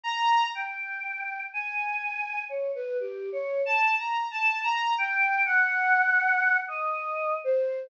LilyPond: \new Staff { \time 4/4 \tempo 4 = 61 bes''8 g''4 aes''4 des''16 b'16 \tuplet 3/2 { g'8 des''8 a''8 } | \tuplet 3/2 { bes''8 a''8 bes''8 } g''8 ges''4~ ges''16 ees''8. c''8 | }